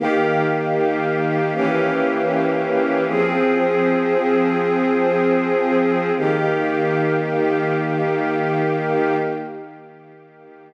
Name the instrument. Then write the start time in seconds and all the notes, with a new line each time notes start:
string ensemble 1
0.00 D#3 A#3 G4
1.54 E3 A#3 C#4 G4
3.07 F3 C4 G#4
6.17 D#3 A#3 G4